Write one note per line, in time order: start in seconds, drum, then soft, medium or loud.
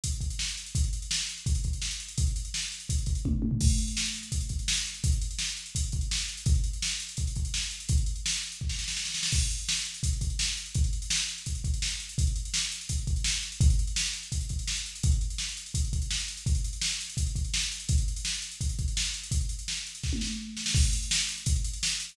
0.04 kick medium
0.04 closed hi-hat loud
0.12 closed hi-hat medium
0.21 kick medium
0.21 closed hi-hat medium
0.30 closed hi-hat medium
0.39 snare loud
0.48 closed hi-hat medium
0.57 closed hi-hat medium
0.66 closed hi-hat medium
0.75 kick loud
0.75 closed hi-hat loud
0.84 closed hi-hat medium
0.93 closed hi-hat medium
1.02 closed hi-hat medium
1.11 snare loud
1.20 closed hi-hat medium
1.29 closed hi-hat medium
1.38 closed hi-hat medium
1.46 kick loud
1.46 closed hi-hat loud
1.55 closed hi-hat medium
1.64 kick medium
1.64 closed hi-hat medium
1.73 closed hi-hat medium
1.82 snare loud
1.91 closed hi-hat medium
2.00 closed hi-hat medium
2.08 closed hi-hat medium
2.18 kick loud
2.18 closed hi-hat loud
2.27 closed hi-hat medium
2.36 closed hi-hat medium
2.45 closed hi-hat medium
2.54 snare loud
2.62 closed hi-hat medium
2.72 closed hi-hat medium
2.80 closed hi-hat medium
2.89 kick loud
2.89 closed hi-hat loud
2.98 closed hi-hat medium
3.06 kick medium
3.06 closed hi-hat medium
3.15 closed hi-hat medium
3.25 kick medium
3.25 high tom loud
3.33 floor tom medium
3.42 high tom loud
3.51 floor tom loud
3.61 kick loud
3.61 crash loud
3.70 closed hi-hat medium
3.78 closed hi-hat medium
3.87 closed hi-hat medium
3.97 snare loud
4.06 closed hi-hat medium
4.14 closed hi-hat medium
4.23 closed hi-hat medium
4.32 kick medium
4.32 closed hi-hat loud
4.41 closed hi-hat medium
4.49 kick medium
4.49 closed hi-hat medium
4.59 closed hi-hat medium
4.68 snare loud
4.77 closed hi-hat medium
4.85 closed hi-hat medium
4.94 closed hi-hat medium
5.04 kick loud
5.04 closed hi-hat loud
5.12 closed hi-hat medium
5.22 closed hi-hat medium
5.31 closed hi-hat medium
5.39 snare loud
5.49 closed hi-hat medium
5.57 closed hi-hat medium
5.66 closed hi-hat medium
5.75 kick medium
5.75 closed hi-hat loud
5.84 closed hi-hat medium
5.92 kick medium
5.92 closed hi-hat medium
6.01 closed hi-hat medium
6.11 snare loud
6.19 closed hi-hat medium
6.28 closed hi-hat medium
6.37 closed hi-hat medium
6.46 kick loud
6.46 closed hi-hat loud
6.55 closed hi-hat medium
6.64 closed hi-hat medium
6.73 closed hi-hat medium
6.82 snare loud
6.91 closed hi-hat medium
7.00 closed hi-hat medium
7.09 closed hi-hat medium
7.17 kick medium
7.17 closed hi-hat loud
7.27 closed hi-hat medium
7.36 kick medium
7.36 closed hi-hat medium
7.45 closed hi-hat medium
7.54 snare loud
7.63 closed hi-hat medium
7.71 closed hi-hat medium
7.80 closed hi-hat medium
7.89 kick loud
7.89 closed hi-hat loud
7.97 closed hi-hat medium
8.06 closed hi-hat medium
8.16 closed hi-hat medium
8.26 snare loud
8.33 closed hi-hat medium
8.43 closed hi-hat medium
8.52 closed hi-hat medium
8.61 kick medium
8.69 snare medium
8.79 snare medium
8.88 snare loud
8.97 snare medium
9.05 snare medium
9.14 snare loud
9.23 snare loud
9.32 kick loud
9.32 crash loud
9.41 closed hi-hat medium
9.50 closed hi-hat medium
9.58 closed hi-hat medium
9.69 snare loud
9.77 closed hi-hat medium
9.85 closed hi-hat medium
9.94 closed hi-hat medium
10.03 kick loud
10.03 closed hi-hat loud
10.13 closed hi-hat medium
10.21 kick medium
10.21 closed hi-hat medium
10.30 closed hi-hat medium
10.39 snare loud
10.48 closed hi-hat medium
10.57 closed hi-hat medium
10.66 closed hi-hat medium
10.74 kick loud
10.74 closed hi-hat loud
10.84 closed hi-hat medium
10.93 closed hi-hat medium
11.02 closed hi-hat medium
11.10 snare loud
11.19 closed hi-hat medium
11.29 closed hi-hat medium
11.38 closed hi-hat medium
11.46 kick medium
11.46 closed hi-hat loud
11.55 closed hi-hat medium
11.64 kick medium
11.64 closed hi-hat medium
11.74 closed hi-hat medium
11.82 snare loud
11.91 closed hi-hat medium
12.00 closed hi-hat medium
12.09 closed hi-hat medium
12.18 kick loud
12.18 closed hi-hat loud
12.27 closed hi-hat medium
12.36 closed hi-hat medium
12.45 closed hi-hat medium
12.54 snare loud
12.63 closed hi-hat medium
12.72 closed hi-hat medium
12.81 closed hi-hat medium
12.89 kick medium
12.89 closed hi-hat loud
12.98 closed hi-hat medium
13.07 kick medium
13.07 closed hi-hat medium
13.16 closed hi-hat medium
13.24 snare loud
13.34 closed hi-hat medium
13.42 closed hi-hat medium
13.52 closed hi-hat medium
13.61 kick loud
13.61 closed hi-hat loud
13.70 closed hi-hat medium
13.79 closed hi-hat medium
13.87 closed hi-hat medium
13.96 snare loud
14.06 closed hi-hat medium
14.13 closed hi-hat medium
14.23 closed hi-hat medium
14.32 kick medium
14.32 closed hi-hat loud
14.41 closed hi-hat medium
14.49 kick medium
14.49 closed hi-hat medium
14.59 closed hi-hat medium
14.67 snare loud
14.76 closed hi-hat medium
14.86 closed hi-hat medium
14.95 closed hi-hat medium
15.03 kick loud
15.03 closed hi-hat loud
15.12 closed hi-hat medium
15.21 closed hi-hat medium
15.30 closed hi-hat medium
15.38 snare loud
15.48 closed hi-hat medium
15.57 closed hi-hat medium
15.66 closed hi-hat medium
15.74 kick loud
15.74 closed hi-hat loud
15.85 closed hi-hat medium
15.93 kick medium
15.93 closed hi-hat medium
16.02 closed hi-hat medium
16.11 snare loud
16.19 closed hi-hat medium
16.28 closed hi-hat medium
16.37 closed hi-hat medium
16.46 kick loud
16.46 closed hi-hat medium
16.55 closed hi-hat medium
16.64 closed hi-hat medium
16.73 closed hi-hat medium
16.81 snare loud
16.92 closed hi-hat medium
17.01 closed hi-hat medium
17.10 closed hi-hat medium
17.17 kick loud
17.17 closed hi-hat loud
17.26 closed hi-hat medium
17.35 kick medium
17.35 closed hi-hat medium
17.44 closed hi-hat medium
17.54 snare loud
17.62 closed hi-hat medium
17.72 closed hi-hat medium
17.80 closed hi-hat medium
17.89 kick loud
17.89 closed hi-hat loud
17.98 closed hi-hat medium
18.08 closed hi-hat medium
18.16 closed hi-hat medium
18.25 snare loud
18.34 closed hi-hat medium
18.42 closed hi-hat medium
18.51 closed hi-hat medium
18.61 kick medium
18.61 closed hi-hat loud
18.69 closed hi-hat medium
18.79 kick medium
18.79 closed hi-hat medium
18.88 closed hi-hat medium
18.97 snare loud
19.05 closed hi-hat medium
19.14 closed hi-hat medium
19.23 closed hi-hat medium
19.31 kick loud
19.31 closed hi-hat loud
19.41 closed hi-hat medium
19.49 closed hi-hat medium
19.59 closed hi-hat medium
19.68 snare loud
19.87 closed hi-hat medium
19.95 closed hi-hat medium
20.03 kick medium
20.03 snare medium
20.13 high tom medium
20.21 snare medium
20.57 snare medium
20.66 snare loud
20.75 kick loud
20.75 crash loud
20.84 closed hi-hat medium
20.93 closed hi-hat loud
21.02 closed hi-hat medium
21.11 snare loud
21.20 closed hi-hat medium
21.29 closed hi-hat medium
21.38 closed hi-hat medium
21.46 kick loud
21.46 closed hi-hat loud
21.56 closed hi-hat medium
21.64 closed hi-hat loud
21.73 closed hi-hat medium
21.83 snare loud
21.91 closed hi-hat medium
22.00 closed hi-hat medium
22.09 closed hi-hat medium